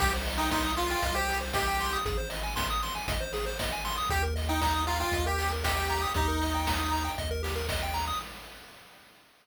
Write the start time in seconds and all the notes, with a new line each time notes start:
0.00 C2 G4, kick, crash
0.13 C5
0.25 D#5, open hi-hat
0.38 D#4 G5
0.51 D#4 C6, kick, snare
0.64 D#6
0.77 F4 C6, open hi-hat
0.90 F4 G5
1.02 C2 D#5, kick, closed hi-hat
1.15 G4 C5
1.28 G4, open hi-hat
1.41 C5
1.53 G4 D#5, kick, snare
1.68 G5
1.79 C6, open hi-hat
1.93 D#6
2.05 G#1 G#4, kick, closed hi-hat
2.18 C5
2.30 D#5, open hi-hat
2.43 G#5
2.56 C6, kick, snare
2.70 D#6
2.82 C6, open hi-hat
2.95 G#5
3.07 G#1 D#5, kick, closed hi-hat
3.21 C5
3.33 G#4, open hi-hat
3.46 C5
3.59 D#5, kick, snare
3.72 G#5
3.85 C6, open hi-hat
3.98 D#6
4.10 D#2 G4, kick, closed hi-hat
4.23 A#4
4.36 D#5, open hi-hat
4.49 D#4 G5
4.61 D#4 A#5, kick, snare
4.74 D#6
4.87 F4 A#5, open hi-hat
5.00 F4 G5
5.12 D#2 D#5, kick, closed hi-hat
5.26 G4 A#4
5.38 G4, open hi-hat
5.52 A#4
5.64 G4 D#5, kick, snare
5.77 G5
5.90 A#5, open hi-hat
6.02 D#6
6.14 D#2 D#4 G4, kick, closed hi-hat
6.28 A#4
6.41 D#5, open hi-hat
6.54 G5
6.67 A#5, kick, snare
6.79 D#6
6.92 A#5, open hi-hat
7.04 G5
7.18 D#2 D#5, kick, closed hi-hat
7.31 A#4
7.43 G4, open hi-hat
7.56 A#4
7.69 D#5, kick, snare
7.83 G5
7.94 A#5, open hi-hat
8.07 D#6